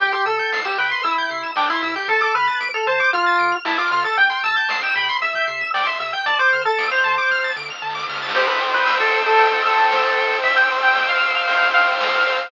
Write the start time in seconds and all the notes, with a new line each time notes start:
0.00 C2 G4 G5, kick, closed hi-hat
0.12 G4 C6, closed hi-hat
0.26 C3 A4 E6, closed hi-hat
0.39 G6, closed hi-hat
0.52 C2 C7, snare
0.65 G4 E7, closed hi-hat
0.78 C3 B4 G5, closed hi-hat
0.91 C6, closed hi-hat
1.03 C2 E4 E6, kick, closed hi-hat
1.17 G6, kick, closed hi-hat
1.29 C3 C7, closed hi-hat
1.43 E7, kick, closed hi-hat
1.56 C2 D4 G5, snare
1.70 E4 C6, closed hi-hat
1.82 C3 E4 E6, closed hi-hat
1.96 G4 G6, open hi-hat
2.08 D2 A4 A5, kick, closed hi-hat
2.21 A4 D6, kick, closed hi-hat
2.35 D3 B4 F6, closed hi-hat
2.47 A6, closed hi-hat
2.60 D2 D7, closed hi-hat
2.74 A4 F7, closed hi-hat
2.87 D3 C5 A5, closed hi-hat
3.00 D6, closed hi-hat
3.13 D2 F4 F6, kick, closed hi-hat
3.26 A6, closed hi-hat
3.39 D3 D7, closed hi-hat
3.52 F7, closed hi-hat
3.65 D2 E4 A5, snare
3.78 F4 D6, closed hi-hat
3.91 D3 F4 F6, closed hi-hat
4.04 A4 A6, closed hi-hat
4.17 C2 G5, kick, closed hi-hat
4.30 G5 C6, closed hi-hat
4.43 C3 A5 E6, closed hi-hat
4.56 G6, closed hi-hat
4.69 C2 C7, snare
4.82 G5 E7, closed hi-hat
4.96 C3 G5 B5, closed hi-hat
5.09 C6, closed hi-hat
5.22 C2 E5 E6, kick, closed hi-hat
5.34 G6, kick, closed hi-hat
5.47 C3 C7, closed hi-hat
5.61 E7, kick, closed hi-hat
5.74 C2 D5 G5, snare
5.86 E5 C6, closed hi-hat
6.00 C3 E5 E6, closed hi-hat
6.12 G5 G6, closed hi-hat
6.26 D2 D5 A5, kick, closed hi-hat
6.39 C5 D6, closed hi-hat
6.52 D3 F6, closed hi-hat
6.65 A4 A6, closed hi-hat
6.78 D2 D7, snare
6.91 C5 F7, closed hi-hat
7.04 D3 A5, closed hi-hat
7.17 D6, closed hi-hat
7.30 D2 F6, kick, snare
7.44 A6, snare
7.55 D3 D7, snare
7.68 F7, snare
7.82 D3 A5, snare
7.89 snare
7.95 D6, snare
8.02 snare
8.09 C#3 F6, snare
8.15 snare
8.22 A6, snare
8.29 snare
8.35 G4 C5, kick, crash
8.48 B4, ride
8.61 G5
8.74 B4
8.86 E6, snare, ride
9.00 A4, ride
9.14 C5, ride
9.26 A4, ride
9.38 G5, kick, ride
9.52 kick, ride
9.64 A4 E6, ride
9.77 ride
9.91 C5, snare
10.04 ride
10.17 G5, ride
10.30 ride
10.44 E5 E6, kick, ride
10.56 G5, ride
10.70 C5, ride
10.83 G5, ride
10.95 G5, snare
11.09 F5, ride
11.22 E6, ride
11.35 F5, ride
11.47 C5, kick, ride
11.61 kick, ride
11.74 F5 G5, ride
11.87 ride
12.00 E6, snare
12.13 ride
12.26 C5, ride
12.39 ride